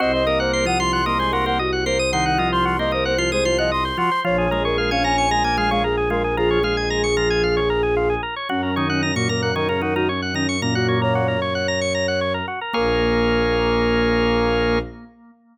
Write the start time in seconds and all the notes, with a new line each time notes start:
0.00 C2 C4 F#4 C5 D#5
0.13 C5 D#5
0.26 A#3 A#4 D#5
0.39 C5 F#5
0.53 C5 C6
0.65 F3 F4 F#5 D#6
0.80 F3 F4 C6
0.93 F#5 C6
1.06 A#3 A#4 D#5 C6
1.19 G#3 G#4 C5 C6
1.32 A#3 F#4 A#4 C6
1.46 A#3 A#4 C5 F#5
1.59 F#4 D#5
1.73 F#5
1.86 A#3 A#4 C5 C6
1.99 D#6
2.12 D#3 D#4 F#5 C6
2.26 F#5
2.38 F3 F4 D#5
2.52 C5 C6
2.65 F#4 C6
2.79 A#3 A#4 C5 D#5
2.91 A#3 A#4 C5 D#5
3.05 C5 F#5
3.18 F3 F4 C5 C6
3.32 G#3 G#4 C5 D#6
3.45 F3 F4 C5 C6
3.58 F3 F4 D#5 F#5
3.72 D#5 C6
3.85 C5
3.97 F3 F4 F#4 C6
4.12 C5
4.24 A#1 F3 F4 C#5
4.38 G#4 C#5
4.51 G#3 G#4 A#4
4.65 A#4 C#5
4.78 A#4 F5
4.91 C#4 C#5 F5 G#5
5.04 C#4 C#5 G#5 A#5
5.18 G#5 C#6
5.31 G#3 G#4 G#5 A#5
5.44 A#3 A#4 G#5
5.57 G#3 G#4 F5 G#5
5.71 G#3 G#4 C#5 F5
5.84 G#4 A#4
5.97 G#4
6.10 G#3 F4 G#4 A#4
6.24 G#4
6.37 F3 F4 G#4 A#4
6.51 C#5
6.63 G#3 G#4 F5
6.77 G#5
6.90 A#5
7.04 C#6
7.17 F3 F4 A#5
7.30 G#5
7.43 F5
7.57 C#5
7.70 A#4
7.83 G#4
7.97 F4
8.10 G#4
8.23 A#4
8.36 C#5
8.49 F#2 F#3 C#4 F#4
8.63 C#4 A#4
8.76 D#3 D#4 C#5
8.89 C#4 F#5
9.03 C#4 A#5
9.15 A#2 A#3 F#4 C#6
9.29 A#2 A#3 A#4 A#5
9.42 A#4 F#5
9.56 D#3 D#4 A#4 C#5
9.69 C#3 C#4 A#4
9.81 D#3 D#4 F#4 A#4
9.96 D#3 D#4 F#4 A#4
10.09 C#4 C#5
10.22 F#5
10.34 D#3 C#4 D#4 A#5
10.49 C#6
10.62 A#2 A#3 C#4 A#5
10.75 F#4 F#5
10.88 C#5
11.02 A#4 C#5
11.15 F#4
11.28 A#4
11.42 C#5
11.55 F#5
11.68 A#5
11.81 C#6
11.95 A#5
12.08 F#5
12.21 C#5
12.34 A#4
12.48 F#4
12.61 A#4
12.73 A#1 A#3 G#4 A#4 C#5 F5